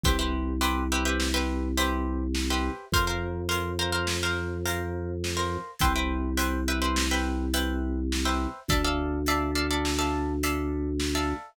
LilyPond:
<<
  \new Staff \with { instrumentName = "Pizzicato Strings" } { \time 5/4 \key c \mixolydian \tempo 4 = 104 <g' b' c'' e''>16 <g' b' c'' e''>8. <g' b' c'' e''>8 <g' b' c'' e''>16 <g' b' c'' e''>8 <g' b' c'' e''>8. <g' b' c'' e''>4~ <g' b' c'' e''>16 <g' b' c'' e''>8. | <bes' c'' f''>16 <bes' c'' f''>8. <bes' c'' f''>8 <bes' c'' f''>16 <bes' c'' f''>8 <bes' c'' f''>8. <bes' c'' f''>4~ <bes' c'' f''>16 <bes' c'' f''>8. | <b' c'' e'' g''>16 <b' c'' e'' g''>8. <b' c'' e'' g''>8 <b' c'' e'' g''>16 <b' c'' e'' g''>8 <b' c'' e'' g''>8. <b' c'' e'' g''>4~ <b' c'' e'' g''>16 <b' c'' e'' g''>8. | <a' d'' e'' f''>16 <a' d'' e'' f''>8. <a' d'' e'' f''>8 <a' d'' e'' f''>16 <a' d'' e'' f''>8 <a' d'' e'' f''>8. <a' d'' e'' f''>4~ <a' d'' e'' f''>16 <a' d'' e'' f''>8. | }
  \new Staff \with { instrumentName = "Drawbar Organ" } { \clef bass \time 5/4 \key c \mixolydian c,1~ c,4 | f,1~ f,4 | c,1~ c,4 | d,1~ d,4 | }
  \new DrumStaff \with { instrumentName = "Drums" } \drummode { \time 5/4 <hh bd>4 hh4 sn4 hh4 sn4 | <hh bd>4 hh4 sn4 hh4 sn4 | <hh bd>4 hh4 sn4 hh4 sn4 | <hh bd>4 hh4 sn4 hh4 sn4 | }
>>